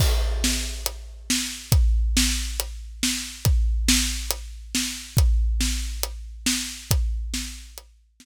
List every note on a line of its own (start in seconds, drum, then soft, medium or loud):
0.00 kick loud
0.00 crash loud
0.44 snare loud
0.86 closed hi-hat loud
1.30 snare loud
1.72 kick loud
1.72 closed hi-hat loud
2.17 snare loud
2.60 closed hi-hat loud
3.03 snare loud
3.45 kick loud
3.45 closed hi-hat loud
3.88 snare loud
4.31 closed hi-hat loud
4.75 snare loud
5.17 kick loud
5.17 closed hi-hat loud
5.61 snare loud
6.03 closed hi-hat loud
6.46 snare loud
6.91 kick loud
6.91 closed hi-hat loud
7.34 snare loud
7.78 closed hi-hat loud
8.20 snare loud